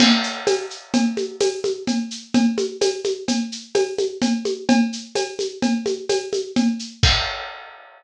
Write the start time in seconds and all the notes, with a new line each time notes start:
0.00 crash, cowbell, low conga, shaker
0.23 shaker
0.47 tambourine, cowbell, high conga, shaker
0.70 shaker
0.94 cowbell, low conga, shaker
1.17 high conga, shaker
1.40 tambourine, cowbell, high conga, shaker
1.64 high conga, shaker
1.87 cowbell, low conga, shaker
2.11 shaker
2.34 cowbell, low conga, shaker
2.58 high conga, shaker
2.81 tambourine, cowbell, high conga, shaker
3.04 high conga, shaker
3.28 cowbell, low conga, shaker
3.52 shaker
3.75 tambourine, cowbell, high conga, shaker
3.98 high conga, shaker
4.22 cowbell, low conga, shaker
4.45 high conga, shaker
4.69 cowbell, low conga, shaker
4.93 shaker
5.15 tambourine, cowbell, high conga, shaker
5.39 high conga, shaker
5.62 cowbell, low conga, shaker
5.86 high conga, shaker
6.09 tambourine, cowbell, high conga, shaker
6.33 high conga, shaker
6.56 cowbell, low conga, shaker
6.79 shaker
7.03 kick, crash